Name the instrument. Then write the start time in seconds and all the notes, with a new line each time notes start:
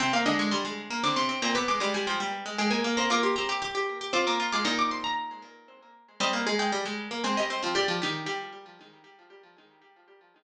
harpsichord
0.00 C3 C4 G5
0.13 A#3 F5
0.26 D3 G#3 D4 D#5
0.39 G#3 C#6
0.51 G3 C6
0.65 G#3
0.90 A#3
1.03 D3 C4 D4 D6
1.16 C3 C4 C6
1.29 C4
1.42 A#2 A#3 C4 A#5
1.55 B3 B4 D6
1.68 G#3 D6
1.80 G3 G#3 G#4 D6
1.94 G3 G#5
2.07 F3 G5
2.20 G3
2.46 G#3
2.58 G#3 G#4 G5
2.70 A#3 A#4 G#5
2.84 A#3
2.97 A#3 C4 C5 A#5
3.10 A#3 F4 A#4 D6
3.23 G4 C6
3.36 C4 G4 C5 A#5
3.49 G4 D6
3.62 G4 D6
3.75 G4
4.01 G4
4.13 C4 F4 C5 D6
4.27 A#3 A#4 D6
4.40 F4
4.52 G#3 F4 G#4 D6
4.65 A#2 A#3 D#4 A#5
4.79 D6
4.91 C6
5.04 A#5
6.20 G3 C4 G4 D#5
6.33 A#3
6.46 G#3 G#4
6.59 G#3 G5
6.72 G3
6.85 G#3
7.11 A#3
7.24 G#3 C4 G#4 G5
7.37 G3 G4 D#5
7.50 C4
7.62 F3 C4 F4
7.75 G3 G4 D5
7.88 F3 F4
8.02 D#3 D#4 G4
8.26 G3 G4